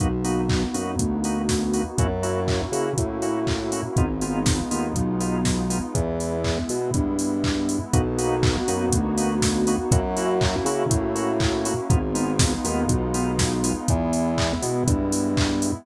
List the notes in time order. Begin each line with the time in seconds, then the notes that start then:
0.00 B1 A#3 B3 D#4 F#4, kick, closed hi-hat
0.24 A#3 B3 D#4 F#4, open hi-hat
0.49 kick, clap
0.74 F#2 A#3 B3 D#4 F#4, open hi-hat
0.99 D2, kick, closed hi-hat
1.24 A#3 B3 D#4 F#4, open hi-hat
1.49 kick, snare
1.74 A#3 B3 D#4 F#4, open hi-hat
1.98 F#2 A#3 C#4 E4 F#4, kick, closed hi-hat
2.23 A#3 C#4 E4 F#4, open hi-hat
2.48 kick, clap
2.72 C#3 A#3 C#4 E4 F#4, open hi-hat
2.98 A2, kick, closed hi-hat
3.22 A#3 C#4 E4 F#4, open hi-hat
3.47 kick, clap
3.72 A#3 C#4 E4 F#4, open hi-hat
3.96 G#1 G#3 B3 D#4 F4, kick, closed hi-hat
4.21 G#3 B3 D#4 F4, open hi-hat
4.46 kick, snare
4.71 D#2 G#3 B3 D#4 F4, open hi-hat
4.95 B1, kick, closed hi-hat
5.20 G#3 B3 D#4 F4, open hi-hat
5.45 kick, snare
5.70 G#3 B3 D#4 F4, open hi-hat
5.95 E2 G#3 B3 E4, kick, closed hi-hat
6.20 open hi-hat
6.44 kick, clap
6.69 B2, open hi-hat
6.94 G2, kick, closed hi-hat
7.19 open hi-hat
7.44 kick, clap
7.69 open hi-hat
7.93 B1 A#3 B3 D#4 F#4, kick, closed hi-hat
8.18 A#3 B3 D#4 F#4, open hi-hat
8.43 kick, clap
8.68 F#2 A#3 B3 D#4 F#4, open hi-hat
8.92 D2, kick, closed hi-hat
9.17 A#3 B3 D#4 F#4, open hi-hat
9.42 kick, snare
9.67 A#3 B3 D#4 F#4, open hi-hat
9.90 F#2 A#3 C#4 E4 F#4, kick, closed hi-hat
10.17 A#3 C#4 E4 F#4, open hi-hat
10.41 kick, clap
10.65 C#3 A#3 C#4 E4 F#4, open hi-hat
10.89 A2, kick, closed hi-hat
11.15 A#3 C#4 E4 F#4, open hi-hat
11.40 kick, clap
11.65 A#3 C#4 E4 F#4, open hi-hat
11.90 G#1 G#3 B3 D#4 F4, kick, closed hi-hat
12.15 G#3 B3 D#4 F4, open hi-hat
12.39 kick, snare
12.64 D#2 G#3 B3 D#4 F4, open hi-hat
12.88 B1, kick, closed hi-hat
13.14 G#3 B3 D#4 F4, open hi-hat
13.39 kick, snare
13.64 G#3 B3 D#4 F4, open hi-hat
13.88 E2 G#3 B3 E4, kick, closed hi-hat
14.13 open hi-hat
14.38 kick, clap
14.62 B2, open hi-hat
14.87 G2, kick, closed hi-hat
15.12 open hi-hat
15.37 kick, clap
15.62 open hi-hat